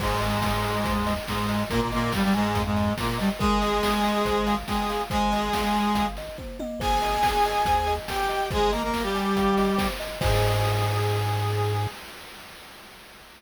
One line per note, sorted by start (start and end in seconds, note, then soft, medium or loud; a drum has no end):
0.00 0.38 G#1 medium
0.00 1.13 G#2 loud
0.00 1.13 G#3 loud
0.00 0.19 C5 medium
0.00 kick medium
0.00 crash medium
0.21 0.40 D#5 medium
0.21 snare soft
0.21 open hi-hat medium
0.42 0.61 G#5 medium
0.42 kick medium
0.42 snare medium
0.64 0.84 D#5 medium
0.64 open hi-hat medium
0.85 1.19 D#2 medium
0.85 1.04 C5 medium
0.85 kick medium
0.85 closed hi-hat medium
1.07 1.26 D#5 medium
1.07 open hi-hat medium
1.28 1.63 G#2 medium
1.28 1.63 G#3 loud
1.28 1.47 G#5 medium
1.28 kick medium
1.28 snare medium
1.49 1.68 D#5 medium
1.49 open hi-hat medium
1.70 2.08 G#1 medium
1.70 1.80 A#2 loud
1.70 1.80 A#3 loud
1.70 1.89 A#4 loud
1.70 kick medium
1.70 closed hi-hat medium
1.81 1.91 A#2 medium
1.81 1.91 A#3 loud
1.91 2.12 A#2 loud
1.91 2.12 A#3 loud
1.91 2.11 D#5 medium
1.91 snare soft
1.91 open hi-hat medium
2.12 2.23 G2 loud
2.12 2.23 G3 loud
2.12 2.33 F5 medium
2.12 kick medium
2.12 snare medium
2.23 2.33 G2 loud
2.23 2.33 G3 loud
2.34 2.62 G#2 loud
2.34 2.62 G#3 loud
2.34 2.53 G#5 medium
2.34 open hi-hat medium
2.55 2.90 F2 medium
2.55 2.74 F5 medium
2.55 kick medium
2.55 closed hi-hat medium
2.65 2.93 G#2 medium
2.65 2.93 G#3 loud
2.76 2.95 D#5 medium
2.76 open hi-hat medium
2.98 3.18 A#2 medium
2.98 3.18 A#3 loud
2.98 3.18 A#4 medium
2.98 kick medium
2.98 snare medium
3.18 3.29 G2 medium
3.18 3.29 G3 loud
3.18 3.37 D#5 medium
3.18 open hi-hat medium
3.39 3.80 G#1 medium
3.39 4.55 G#3 loud
3.39 4.55 G#4 loud
3.39 3.59 A#4 medium
3.39 kick loud
3.39 closed hi-hat medium
3.62 3.81 D#5 medium
3.62 snare soft
3.62 open hi-hat medium
3.83 4.02 G#5 medium
3.83 kick medium
3.83 snare loud
4.04 4.23 D#5 medium
4.04 open hi-hat medium
4.25 4.63 G#1 medium
4.25 4.45 C5 medium
4.25 kick medium
4.25 closed hi-hat medium
4.47 4.66 F5 medium
4.47 open hi-hat medium
4.67 5.02 G#3 medium
4.67 5.02 G#4 loud
4.67 4.88 G5 medium
4.67 kick medium
4.67 snare medium
4.89 5.09 F5 medium
4.89 snare soft
4.89 open hi-hat medium
5.10 5.50 G#1 medium
5.10 6.06 G#3 loud
5.10 6.06 G#4 loud
5.10 5.30 C5 medium
5.10 kick medium
5.10 closed hi-hat medium
5.32 5.52 D#5 medium
5.32 snare soft
5.32 open hi-hat medium
5.53 5.73 F5 medium
5.53 kick medium
5.53 snare medium
5.74 5.93 G#5 medium
5.74 open hi-hat medium
5.95 6.29 G#1 medium
5.95 6.14 F5 medium
5.95 kick medium
5.95 closed hi-hat medium
6.16 6.37 D#5 medium
6.16 snare soft
6.16 open hi-hat medium
6.38 6.57 C5 medium
6.38 kick medium
6.38 high tom medium
6.59 6.79 D#5 medium
6.59 high tom medium
6.80 7.18 G#1 medium
6.80 7.94 G#4 loud
6.80 6.99 C5 medium
6.80 7.94 G#5 loud
6.80 kick medium
6.80 crash medium
7.02 7.21 D#5 medium
7.02 snare soft
7.02 open hi-hat medium
7.23 7.42 G#5 medium
7.23 kick medium
7.23 snare medium
7.45 7.65 D#5 medium
7.45 open hi-hat medium
7.65 7.99 D#2 medium
7.65 7.86 C5 medium
7.65 kick medium
7.65 closed hi-hat medium
7.87 8.06 D#5 medium
7.87 snare soft
7.87 open hi-hat medium
8.08 8.48 G4 medium
8.08 8.48 G5 medium
8.08 8.27 G#5 medium
8.08 kick medium
8.08 snare medium
8.29 8.48 D#5 medium
8.29 open hi-hat medium
8.50 8.90 G#1 medium
8.50 8.71 G#3 loud
8.50 8.71 G#4 loud
8.50 8.69 C5 medium
8.50 kick loud
8.50 closed hi-hat medium
8.72 8.82 A#3 loud
8.72 8.82 A#4 loud
8.72 8.92 D#5 medium
8.72 snare soft
8.72 open hi-hat medium
8.83 9.03 A#3 medium
8.83 9.03 A#4 loud
8.93 9.13 F5 medium
8.93 kick medium
8.93 snare medium
9.03 9.88 G3 loud
9.03 9.88 G4 loud
9.15 9.34 G#5 medium
9.15 open hi-hat medium
9.36 9.70 G#1 medium
9.36 9.56 F5 medium
9.36 kick medium
9.36 closed hi-hat medium
9.57 9.77 D#5 medium
9.57 open hi-hat medium
9.78 9.97 C5 medium
9.78 kick medium
9.78 snare loud
10.00 10.19 D#5 medium
10.00 open hi-hat medium
10.21 11.87 G#2 loud
10.21 11.88 G#4 loud
10.21 11.87 C5 loud
10.21 11.87 D#5 loud
10.21 11.87 G#5 loud
10.21 kick loud
10.21 crash loud